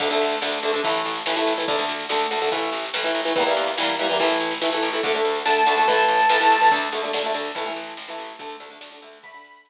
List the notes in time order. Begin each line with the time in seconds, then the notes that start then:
0.00 D2 D3 A3, kick, snare, crash
0.10 D3 A3, snare
0.21 D2, snare
0.31 snare
0.42 D2 D3 A3, snare
0.52 snare
0.63 D2 D3 A3, snare
0.73 D3 A3, snare
0.84 A1 E3 A3, kick, snare
0.94 snare
1.05 A1, snare
1.15 snare
1.26 A1 E3 A3, snare
1.36 E3 A3, snare
1.47 A1, snare
1.57 E3 A3, snare
1.68 D2 D3 A3, kick, snare
1.78 D3 A3, snare
1.88 D2, snare
1.99 snare
2.09 D2 D3 A3, snare
2.20 snare
2.31 D2 D3 A3, snare
2.41 D3 A3, snare
2.52 A1 E3 A3, kick, snare
2.62 snare
2.72 A1, snare
2.83 snare
2.94 A1 E3 A3, snare
3.04 E3 A3, snare
3.15 A1, snare
3.25 E3 A3, snare
3.36 E2 E3 G3, kick, snare
3.40 A#3
3.46 E3 G3 A#3, snare
3.56 E2, snare
3.67 snare
3.78 E2 E3 G3 A#3, snare
3.88 snare
3.99 E2 E3 G3, snare
4.03 A#3
4.09 E3 G3 A#3, snare
4.19 A1 E3 A3, kick, snare
4.30 snare
4.40 A1, snare
4.51 snare
4.61 A1 E3 A3, snare
4.72 E3 A3, snare
4.83 A1, snare
4.93 E3 A3, snare
5.03 D2 D3 A3, kick, snare
5.14 D3 A3, snare
5.24 D2, snare
5.35 snare
5.45 D2 D3 A3 A5, snare
5.56 snare
5.66 D2 D3 A3, snare
5.77 D3 A3, snare
5.87 A1 E3 A3, kick, snare
5.98 snare
6.08 A1, snare
6.19 snare
6.29 A1 E3 A3, snare
6.40 E3 A3, snare
6.50 A1, snare
6.61 E3 A3, snare
6.71 D2 D3 A3, kick, snare
6.82 snare
6.92 D2 D3 A3, snare
7.03 D3 A3, snare
7.13 D2 D3 A3, snare
7.24 D3 A3, snare
7.34 D2 D3 A3, snare
7.45 snare
7.55 A1 E3 A3, kick, snare
7.66 E3 A3, snare
7.76 A1, snare
7.87 snare
7.97 A1, snare
8.08 E3 A3, snare
8.18 A1, snare
8.29 snare
8.39 D2 D3 A3, kick, snare
8.50 snare
8.60 D2 D3 A3, snare
8.70 D3 A3, snare
8.81 D2 D3 A3, snare
8.92 D3 A3, snare
9.02 D2 D3 A3, snare
9.13 snare
9.23 D3 A3 B5, kick, snare
9.34 D3 A3, snare
9.44 D2, snare
9.55 snare
9.65 D2, snare